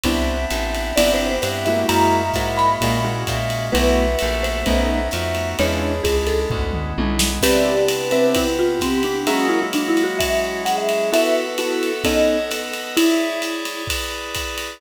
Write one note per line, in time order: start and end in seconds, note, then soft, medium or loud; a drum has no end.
0.03 0.46 C2 medium
0.03 0.96 B3 medium
0.03 0.37 B3 loud
0.03 0.96 C4 medium
0.03 0.37 C4 loud
0.03 0.96 D4 medium
0.03 0.37 D4 loud
0.03 0.96 E4 medium
0.03 0.37 E4 loud
0.03 1.34 E5 medium
0.03 kick medium
0.03 ride medium
0.50 0.93 A1 medium
0.50 hi-hat pedal medium
0.50 ride medium
0.75 ride medium
0.96 1.39 G1 medium
0.96 1.88 B3 medium
0.96 1.30 B3 loud
0.96 1.88 C4 medium
0.96 1.30 C4 medium
0.96 1.30 D4 medium
0.96 1.88 E4 medium
0.96 1.30 E4 medium
0.96 1.88 G4 medium
0.96 1.11 D5 medium
0.96 ride loud
1.14 1.28 C5 medium
1.29 1.42 C5 medium
1.42 1.85 G2 medium
1.42 1.61 C5 medium
1.42 1.87 E5 medium
1.42 hi-hat pedal medium
1.42 ride medium
1.65 2.22 G#3 loud
1.65 2.22 A#3 loud
1.65 2.22 E4 loud
1.65 2.22 F#4 loud
1.65 1.86 E5 medium
1.65 ride medium
1.88 2.31 F#2 medium
1.88 2.80 G#3 medium
1.88 2.80 A#3 medium
1.88 2.80 E4 medium
1.88 2.80 F#4 medium
1.88 3.05 E5 medium
1.88 2.46 A#5 medium
1.88 ride loud
2.34 2.77 G#2 medium
2.34 2.68 G#3 medium
2.34 2.68 A#3 medium
2.34 2.68 E4 medium
2.34 2.68 F#4 medium
2.34 kick medium
2.34 hi-hat pedal medium
2.34 ride medium
2.57 3.24 B5 medium
2.57 ride medium
2.81 3.24 A#2 medium
2.81 2.97 G#3 medium
2.81 3.73 G#3 medium
2.81 2.97 A#3 loud
2.81 3.73 A#3 medium
2.81 3.73 C#4 medium
2.81 2.97 E4 medium
2.81 2.97 F#4 medium
2.81 3.73 F#4 medium
2.81 kick medium
2.81 ride medium
3.05 3.37 G#3 medium
3.05 3.37 A#3 medium
3.05 3.37 E4 loud
3.05 3.37 F#4 medium
3.27 3.70 A#2 medium
3.27 3.66 E5 medium
3.27 kick medium
3.27 hi-hat pedal medium
3.27 ride medium
3.50 ride medium
3.72 4.16 B1 medium
3.72 4.05 A3 loud
3.72 4.19 A3 medium
3.72 4.05 B3 loud
3.72 4.19 B3 medium
3.72 4.05 E4 loud
3.72 4.19 E4 medium
3.72 4.05 F#4 loud
3.72 4.19 F#4 medium
3.72 4.38 B4 medium
3.72 5.07 E5 loud
3.72 ride medium
4.19 4.64 A#1 medium
4.19 4.65 A3 medium
4.19 4.65 B3 medium
4.19 4.65 F#4 medium
4.19 4.65 A4 medium
4.19 hi-hat pedal medium
4.19 ride medium
4.43 5.08 C5 medium
4.43 ride medium
4.66 5.09 B1 medium
4.66 5.12 A3 medium
4.66 4.99 A3 loud
4.66 5.12 B3 medium
4.66 4.99 B3 loud
4.66 5.12 C#4 medium
4.66 4.99 C#4 medium
4.66 5.12 D#4 medium
4.66 4.99 D#4 loud
4.66 kick medium
4.66 ride medium
5.11 5.55 F2 medium
5.11 5.58 A3 medium
5.11 5.58 B3 medium
5.11 5.58 D#4 medium
5.11 5.58 F#4 medium
5.11 5.49 E5 medium
5.11 hi-hat pedal medium
5.11 ride medium
5.35 ride medium
5.58 6.01 E2 medium
5.58 6.50 G#3 medium
5.58 5.92 G#3 loud
5.58 6.50 C#4 medium
5.58 5.92 C#4 loud
5.58 6.50 D4 medium
5.58 5.92 D4 loud
5.58 6.50 E4 medium
5.58 5.70 E4 loud
5.58 5.92 E4 loud
5.58 6.04 C#5 medium
5.58 ride medium
5.69 5.80 F4 medium
5.81 6.44 G#4 medium
6.03 6.46 C#2 medium
6.03 6.23 G#4 medium
6.03 kick medium
6.03 hi-hat pedal medium
6.03 ride medium
6.27 6.90 A4 medium
6.27 ride medium
6.50 6.93 D2 medium
6.50 7.42 G#3 medium
6.50 7.42 B3 medium
6.50 7.42 C#4 medium
6.50 7.42 E4 medium
6.50 kick medium
6.50 floor tom medium
6.73 mid tom medium
6.98 7.39 B1 medium
6.98 7.30 G#3 medium
6.98 7.30 C#4 medium
6.98 7.30 D4 medium
6.98 7.30 E4 medium
6.98 high tom medium
7.19 snare loud
7.41 8.34 C3 medium
7.41 8.34 B3 medium
7.41 7.75 C4 loud
7.41 8.34 D4 medium
7.41 8.34 E4 medium
7.41 8.05 G4 medium
7.41 7.75 B4 loud
7.41 7.75 D5 loud
7.41 7.83 D5 loud
7.41 7.75 E5 loud
7.41 kick medium
7.41 crash loud
7.41 ride loud
7.88 8.72 B4 medium
7.88 hi-hat pedal medium
7.88 ride medium
8.11 8.44 C4 loud
8.11 8.33 B4 medium
8.11 8.44 B4 medium
8.11 8.44 D5 loud
8.11 8.44 E5 medium
8.11 ride medium
8.35 9.26 C3 medium
8.35 9.26 B3 medium
8.35 9.26 C4 medium
8.35 9.26 E4 medium
8.35 8.56 E4 medium
8.35 kick medium
8.35 ride loud
8.59 8.80 F4 medium
8.80 9.02 C4 medium
8.80 9.19 G4 medium
8.80 kick soft
8.80 hi-hat pedal medium
8.80 ride medium
9.03 9.27 D4 medium
9.03 ride medium
9.27 10.19 F#3 medium
9.27 10.19 G#3 medium
9.27 10.19 A#3 medium
9.27 9.47 C#4 medium
9.27 10.19 E4 medium
9.27 9.59 F#4 loud
9.27 9.65 F#4 loud
9.27 9.59 G#4 loud
9.27 9.59 A#4 loud
9.27 9.59 E5 loud
9.27 ride medium
9.49 9.60 E4 medium
9.62 9.73 E4 medium
9.73 9.89 D4 medium
9.73 10.62 F#4 medium
9.73 hi-hat pedal medium
9.73 ride medium
9.88 10.03 E4 medium
9.97 ride medium
10.04 10.18 F#4 medium
10.19 11.11 F#3 medium
10.19 11.11 G#3 medium
10.19 11.11 C#4 medium
10.19 11.11 E4 medium
10.19 10.62 E5 medium
10.19 kick medium
10.19 ride loud
10.65 11.10 G#4 medium
10.65 10.76 F#5 medium
10.65 hi-hat pedal medium
10.65 ride medium
10.78 11.09 E5 medium
10.89 ride medium
11.12 11.57 B3 medium
11.12 11.45 B3 loud
11.12 11.45 E4 loud
11.12 11.57 F#4 medium
11.12 11.45 F#4 loud
11.12 11.57 A4 medium
11.12 11.45 A4 loud
11.12 11.40 B4 medium
11.12 11.57 E5 medium
11.12 11.35 E5 medium
11.12 ride medium
11.43 11.70 B4 medium
11.58 12.04 B3 medium
11.58 11.91 B3 medium
11.58 11.91 E4 medium
11.58 12.04 F#4 medium
11.58 11.91 F#4 medium
11.58 11.91 A4 loud
11.58 12.04 B4 medium
11.58 12.04 E5 medium
11.58 hi-hat pedal medium
11.58 ride medium
11.74 11.99 A4 medium
11.83 ride medium
12.04 12.37 B3 loud
12.04 12.50 B3 medium
12.04 12.37 C#4 loud
12.04 12.37 D#4 loud
12.04 12.37 A4 loud
12.04 12.50 A4 medium
12.04 12.50 C#5 medium
12.04 12.50 D#5 medium
12.04 12.44 D#5 medium
12.04 kick medium
12.04 ride medium
12.39 12.60 A4 medium
12.51 12.96 B3 medium
12.51 12.96 A4 medium
12.51 12.96 B4 medium
12.51 12.96 D#5 medium
12.51 hi-hat pedal medium
12.51 ride medium
12.62 12.73 A4 medium
12.73 ride medium
12.97 13.83 E4 medium
12.97 13.88 E4 medium
12.97 13.42 E4 loud
12.97 13.88 G#4 medium
12.97 13.88 C#5 medium
12.97 13.88 D5 medium
12.97 ride loud
13.42 hi-hat pedal medium
13.42 ride medium
13.65 ride medium
13.87 14.80 E4 medium
13.87 14.80 G#4 medium
13.87 14.80 B4 medium
13.87 14.80 D5 medium
13.87 kick medium
13.87 ride loud
14.35 kick medium
14.35 hi-hat pedal medium
14.35 ride medium
14.58 ride medium